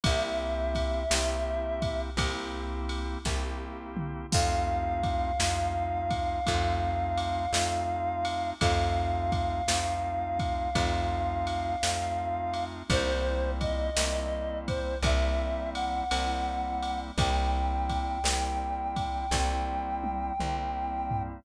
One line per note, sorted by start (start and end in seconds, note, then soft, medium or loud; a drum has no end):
0.04 1.06 C2 loud
0.04 1.04 A#3 medium
0.04 1.04 C4 medium
0.04 1.04 E4 medium
0.04 1.04 G4 medium
0.04 2.01 E5 medium
0.04 kick loud
0.04 ride loud
0.75 kick medium
0.75 ride medium
1.10 2.11 C2 medium
1.10 2.10 A#3 medium
1.10 2.10 C4 medium
1.10 2.10 E4 medium
1.10 2.10 G4 medium
1.10 snare loud
1.82 kick medium
1.82 ride medium
2.17 3.17 C2 loud
2.17 3.18 A#3 medium
2.17 3.18 C4 medium
2.17 3.18 E4 medium
2.17 3.18 G4 medium
2.17 kick medium
2.17 ride medium
2.89 ride medium
3.25 4.26 C2 medium
3.25 4.26 A#3 medium
3.25 4.26 C4 medium
3.25 4.26 E4 medium
3.25 4.26 G4 medium
3.25 kick medium
3.25 snare medium
3.97 mid tom medium
4.32 5.34 F2 medium
4.32 5.32 A3 medium
4.32 5.32 C4 medium
4.32 5.32 D#4 medium
4.32 5.32 F4 medium
4.32 8.50 F5 medium
4.32 kick loud
4.32 crash loud
5.04 kick medium
5.04 ride medium
5.40 6.40 F2 medium
5.40 6.40 A3 medium
5.40 6.40 C4 medium
5.40 6.40 D#4 medium
5.40 6.40 F4 medium
5.40 snare loud
6.11 kick medium
6.11 ride medium
6.46 7.48 F2 loud
6.46 7.46 A3 medium
6.46 7.46 C4 medium
6.46 7.46 D#4 medium
6.46 7.46 F4 medium
6.46 kick medium
6.46 ride medium
7.18 ride medium
7.53 8.53 F2 medium
7.53 8.54 A3 medium
7.53 8.54 C4 medium
7.53 8.54 D#4 medium
7.53 8.54 F4 medium
7.53 snare loud
8.25 ride medium
8.61 9.62 F2 loud
8.61 9.62 A3 medium
8.61 9.62 C4 medium
8.61 9.62 D#4 medium
8.61 9.62 F4 medium
8.61 12.65 F5 medium
8.61 kick medium
8.61 ride loud
9.32 kick medium
9.32 ride medium
9.68 10.68 F2 medium
9.68 10.69 A3 medium
9.68 10.69 C4 medium
9.68 10.69 D#4 medium
9.68 10.69 F4 medium
9.68 snare loud
10.40 kick medium
10.40 ride medium
10.75 11.76 F2 loud
10.75 11.76 A3 medium
10.75 11.76 C4 medium
10.75 11.76 D#4 medium
10.75 11.76 F4 medium
10.75 kick medium
10.75 ride medium
11.47 ride medium
11.83 12.83 F2 medium
11.83 12.83 A3 medium
11.83 12.83 C4 medium
11.83 12.83 D#4 medium
11.83 12.83 F4 medium
11.83 snare medium
12.54 ride medium
12.90 13.90 C2 loud
12.90 13.90 G3 medium
12.90 13.90 A#3 medium
12.90 13.90 C4 medium
12.90 13.90 E4 medium
12.90 13.51 C5 medium
12.90 kick medium
12.90 ride loud
13.61 14.59 D#5 medium
13.61 kick medium
13.61 ride medium
13.96 14.97 C2 medium
13.96 14.96 G3 medium
13.96 14.96 A#3 medium
13.96 14.96 C4 medium
13.96 14.96 E4 medium
13.96 snare loud
14.68 14.98 C5 medium
14.68 kick medium
14.68 ride medium
15.03 16.02 C2 loud
15.03 16.04 G3 medium
15.03 16.04 A#3 medium
15.03 16.04 C4 medium
15.03 16.04 E4 medium
15.03 15.70 E5 medium
15.03 kick medium
15.03 ride medium
15.75 17.00 F#5 medium
15.75 ride medium
16.11 17.12 C2 medium
16.11 17.11 G3 medium
16.11 17.11 A#3 medium
16.11 17.11 C4 medium
16.11 17.11 E4 medium
16.11 ride medium
16.83 ride medium
17.18 18.18 C2 loud
17.18 18.19 G3 medium
17.18 18.19 A#3 medium
17.18 18.19 C4 medium
17.18 18.19 E4 medium
17.18 21.23 G5 medium
17.18 kick loud
17.18 ride medium
17.90 kick medium
17.90 ride medium
18.24 19.24 C2 medium
18.24 19.26 G3 medium
18.24 19.26 A#3 medium
18.24 19.26 C4 medium
18.24 19.26 E4 medium
18.24 snare loud
18.96 kick medium
18.96 ride medium
19.31 20.31 C2 medium
19.31 20.33 G3 medium
19.31 20.33 A#3 medium
19.31 20.33 C4 medium
19.31 20.33 E4 medium
19.31 kick medium
19.31 snare medium
20.04 high tom medium
20.40 21.40 C2 medium
20.40 21.40 G3 medium
20.40 21.40 A#3 medium
20.40 21.40 C4 medium
20.40 21.40 E4 medium
20.40 mid tom medium
21.11 floor tom loud